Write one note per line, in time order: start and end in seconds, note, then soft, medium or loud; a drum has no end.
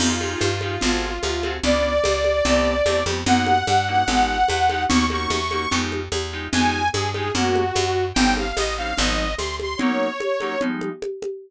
0.00 0.36 F2 medium
0.00 0.14 D#4 medium
0.00 0.14 F4 medium
0.00 1.53 F4 medium
0.00 0.14 G4 medium
0.00 0.14 G#4 medium
0.00 crash loud
0.00 low conga medium
0.20 0.49 D#4 medium
0.20 0.49 F4 medium
0.20 0.49 G4 medium
0.20 0.49 G#4 medium
0.20 high conga medium
0.41 0.78 G2 medium
0.41 high conga medium
0.61 0.76 D#4 medium
0.61 0.76 F4 medium
0.61 0.76 G4 medium
0.61 0.76 G#4 medium
0.61 high conga medium
0.81 1.19 G#1 medium
0.81 1.10 C4 medium
0.81 1.10 F#4 medium
0.81 1.10 G#4 medium
0.81 1.10 A4 medium
0.81 low conga medium
1.23 1.60 D2 medium
1.23 high conga medium
1.43 1.57 C4 medium
1.43 1.57 F#4 medium
1.43 1.57 G#4 medium
1.43 1.57 A4 medium
1.43 high conga medium
1.63 2.00 C#2 medium
1.63 1.92 B3 medium
1.63 1.92 C#4 medium
1.63 1.92 D4 medium
1.63 1.92 F4 medium
1.63 3.04 D5 loud
1.63 low conga medium
2.04 2.42 C#2 medium
2.04 high conga medium
2.24 high conga medium
2.45 2.82 C2 medium
2.45 2.74 A3 medium
2.45 2.74 B3 medium
2.45 2.74 C4 medium
2.45 2.74 G4 medium
2.45 low conga medium
2.86 3.04 E2 medium
2.86 3.00 A3 medium
2.86 3.00 B3 medium
2.86 3.00 C4 medium
2.86 3.00 G4 medium
2.86 high conga medium
3.06 3.24 F2 medium
3.06 3.20 A3 medium
3.06 3.20 B3 medium
3.06 3.20 C4 medium
3.06 3.20 G4 medium
3.06 high conga medium
3.26 3.63 F#2 medium
3.26 3.55 A#3 medium
3.26 3.55 C#4 medium
3.26 3.55 D#4 medium
3.26 3.55 F#4 medium
3.26 4.84 F#5 medium
3.26 low conga loud
3.47 high conga medium
3.67 4.04 G2 medium
3.67 high conga medium
3.88 4.02 A#3 medium
3.88 4.02 C#4 medium
3.88 4.02 D#4 medium
3.88 4.02 F#4 medium
4.08 4.44 G#1 medium
4.08 4.37 G#3 medium
4.08 4.37 D#4 medium
4.08 4.37 F4 medium
4.08 4.37 G4 medium
4.08 low conga medium
4.48 4.86 E2 medium
4.48 high conga medium
4.69 4.84 G#3 medium
4.69 4.84 D#4 medium
4.69 4.84 F4 medium
4.69 4.84 G4 medium
4.69 high conga medium
4.89 5.27 D#2 medium
4.89 5.04 A#3 medium
4.89 5.04 C#4 medium
4.89 5.04 D#4 medium
4.89 5.04 F#4 medium
4.89 5.06 C#6 loud
4.89 low conga loud
5.10 5.39 A#3 medium
5.10 5.39 C#4 medium
5.10 5.39 D#4 medium
5.10 5.39 F#4 medium
5.10 5.77 C#6 medium
5.10 high conga medium
5.30 5.67 E2 medium
5.30 high conga medium
5.51 5.65 A#3 medium
5.51 5.65 C#4 medium
5.51 5.65 D#4 medium
5.51 5.65 F#4 medium
5.51 high conga medium
5.71 6.09 F2 medium
5.71 6.00 G#3 medium
5.71 6.00 D#4 medium
5.71 6.00 F4 medium
5.71 6.00 G4 medium
5.71 low conga medium
5.92 high conga medium
6.12 6.49 E2 medium
6.12 high conga medium
6.32 6.47 G#3 medium
6.32 6.47 D#4 medium
6.32 6.47 F4 medium
6.32 6.47 G4 medium
6.52 6.90 F2 medium
6.52 6.82 G#3 medium
6.52 6.82 D#4 medium
6.52 6.82 F4 medium
6.52 6.82 G4 medium
6.52 6.88 G#5 loud
6.52 low conga loud
6.93 7.31 G2 medium
6.93 7.10 G#4 loud
6.93 high conga medium
7.14 7.28 G#3 medium
7.14 7.28 D#4 medium
7.14 7.28 F4 medium
7.14 7.28 G4 medium
7.14 7.32 G#4 medium
7.14 high conga medium
7.34 7.72 F#2 medium
7.34 7.63 G#3 medium
7.34 7.63 A#3 medium
7.34 7.63 C#4 medium
7.34 7.63 F#4 medium
7.34 8.05 F#4 medium
7.34 low conga medium
7.55 high conga medium
7.75 8.13 F#2 medium
7.75 high conga medium
8.14 8.53 G1 medium
8.14 8.45 G3 medium
8.14 8.45 C4 medium
8.14 8.45 C#4 medium
8.14 8.45 D#4 medium
8.14 8.34 G5 loud
8.14 low conga loud
8.37 8.57 F5 medium
8.37 high conga medium
8.56 8.94 A1 medium
8.56 8.74 D#5 loud
8.56 high conga medium
8.78 8.92 G3 medium
8.78 8.92 C4 medium
8.78 8.92 C#4 medium
8.78 8.92 D#4 medium
8.78 8.98 F5 medium
8.98 9.35 G#1 medium
8.98 9.26 F3 medium
8.98 9.26 G#3 medium
8.98 9.26 C4 medium
8.98 9.26 D#4 medium
8.98 9.34 D#5 medium
8.98 low conga medium
9.38 9.76 D2 medium
9.38 9.56 C6 medium
9.38 high conga medium
9.60 9.79 C6 medium
9.60 high conga medium
9.77 10.08 F#3 medium
9.77 10.08 A#3 medium
9.77 10.08 C#4 medium
9.77 10.08 D#4 medium
9.77 10.61 C#5 medium
9.77 low conga loud
10.20 high conga medium
10.40 10.55 F#3 medium
10.40 10.55 A#3 medium
10.40 10.55 C#4 medium
10.40 10.55 D#4 medium
10.40 high conga medium
10.61 10.90 F3 medium
10.61 10.90 G3 medium
10.61 10.90 G#3 medium
10.61 10.90 D#4 medium
10.61 low conga medium
10.81 high conga medium
11.02 high conga medium
11.22 high conga medium